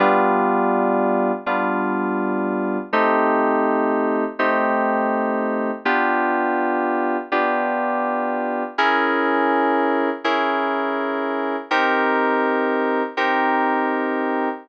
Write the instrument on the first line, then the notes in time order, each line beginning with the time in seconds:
electric piano 2
0.00 G3 B3 D4 F4
1.46 G3 B3 D4 F4
2.93 A3 C4 D#4 G4
4.39 A3 C4 D#4 G4
5.85 B3 D4 F4 G4
7.32 B3 D4 F4 G4
8.78 C#4 E4 G#4 A#4
10.24 C#4 E4 G#4 A#4
11.71 C4 D#4 G4 A#4
13.17 C4 D#4 G4 A#4